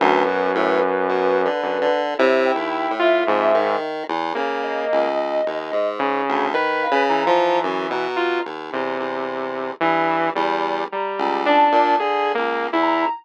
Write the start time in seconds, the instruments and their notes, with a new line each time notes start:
0.00 lead 1 (square) D2, lead 2 (sawtooth) F#2, ocarina B4
0.27 lead 1 (square) B2
0.55 lead 1 (square) A2
1.09 lead 1 (square) B2
1.45 lead 1 (square) D3
1.63 lead 2 (sawtooth) F#2
1.81 lead 1 (square) D3
2.18 lead 1 (square) C3, lead 2 (sawtooth) E4, ocarina C#5
2.45 ocarina G5
2.55 lead 1 (square) D#2
2.91 lead 1 (square) A2
2.99 lead 2 (sawtooth) F4, ocarina E5
3.27 lead 1 (square) F2, lead 2 (sawtooth) G#2
3.55 lead 1 (square) D#3
4.08 lead 1 (square) E2
4.35 lead 1 (square) C#3, lead 2 (sawtooth) A#3
4.63 ocarina D#5
4.92 lead 1 (square) C#2
5.46 lead 1 (square) D#2
5.72 lead 1 (square) G#2
5.99 lead 2 (sawtooth) C#3
6.29 lead 1 (square) D2
6.54 lead 1 (square) D#3, lead 2 (sawtooth) B4
6.82 ocarina F5
6.91 lead 1 (square) C#3
7.09 lead 2 (sawtooth) E3, ocarina A#5
7.27 lead 1 (square) F3
7.63 lead 1 (square) F#2
7.90 lead 1 (square) B2, ocarina A#5
8.16 lead 2 (sawtooth) F4
8.45 lead 1 (square) D#2
8.73 lead 1 (square) E2, lead 2 (sawtooth) C3
9.00 lead 1 (square) E2
9.80 lead 1 (square) G2, lead 2 (sawtooth) E3
10.35 lead 1 (square) E2, lead 2 (sawtooth) G3
10.91 lead 2 (sawtooth) G3, ocarina A#5
11.18 lead 1 (square) C#2
11.46 lead 2 (sawtooth) D4, ocarina A5
11.72 lead 1 (square) A#2
11.99 lead 1 (square) D3, lead 2 (sawtooth) G#4
12.35 lead 1 (square) C#2, lead 2 (sawtooth) A#3
12.73 lead 1 (square) E2, lead 2 (sawtooth) E4
12.82 ocarina A#5